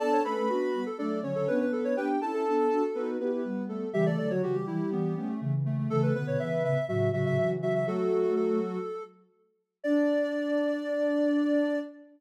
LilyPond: <<
  \new Staff \with { instrumentName = "Ocarina" } { \time 4/4 \key d \major \tempo 4 = 122 <a' a''>8 <b' b''>4. <d' d''>8 <cis' cis''>4 <b b'>8 | <g' g''>8 <a' a''>4. <b b'>8 <b b'>4 <a a'>8 | <g g'>16 <a a'>8 <fis fis'>16 <fis fis'>16 <g g'>4.~ <g g'>16 r4 | <a a'>8 <b b'>4. <fis fis'>8 <fis fis'>4 <fis fis'>8 |
<fis fis'>2 r2 | d''1 | }
  \new Staff \with { instrumentName = "Ocarina" } { \time 4/4 \key d \major d''16 cis''16 a'8 fis'8. a'16 a'8 r16 a'16 b'16 b'16 a'16 cis''16 | b'16 r8 a'4.~ a'16 r4. | e''16 d''16 d''16 cis''16 g'8 e'8 b8 b16 a16 a16 r16 a16 a16 | a'16 b'16 b'16 cis''16 e''8 e''8 e''8 e''16 e''16 e''16 r16 e''16 e''16 |
a'4 a'4. r4. | d''1 | }
  \new Staff \with { instrumentName = "Ocarina" } { \time 4/4 \key d \major <b d'>8 <a cis'>16 <a cis'>16 <b d'>8 <g b>16 r16 <fis a>8 <d fis>16 <d fis>16 <b d'>4 | <b d'>8 <cis' e'>16 <cis' e'>16 <b d'>8 <d' fis'>16 r16 <dis' fis'>8 <e' g'>16 <e' g'>16 <g b>4 | <cis e>8 <d fis>16 <d fis>16 <cis e>8 <e g>16 r16 <e g>8 <a cis'>16 <a cis'>16 <cis e>4 | <cis e>8 <b, d>16 <b, d>16 <cis e>8 <a, cis>16 r16 <a, cis>8 <a, cis>16 <a, cis>16 <cis e>4 |
<fis a>4. r2 r8 | d'1 | }
>>